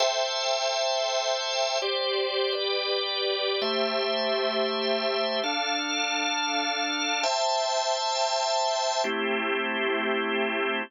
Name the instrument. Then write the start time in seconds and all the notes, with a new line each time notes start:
drawbar organ
0.00 A4 C5 E5 G5
1.82 G4 C5 D5
2.52 G4 B4 D5
3.62 A3 G4 C5 E5
5.43 D4 A4 F5
7.23 C5 E5 G5 A5
9.04 A3 C4 E4 G4